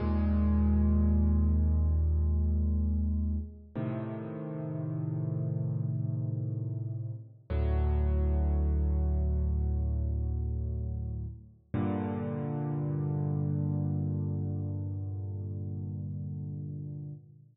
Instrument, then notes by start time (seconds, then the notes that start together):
acoustic grand piano
0.00 D#2 A#2 G#3
3.75 A2 C3 D#3
7.50 D2 A2 F#3
11.74 G2 A#2 D3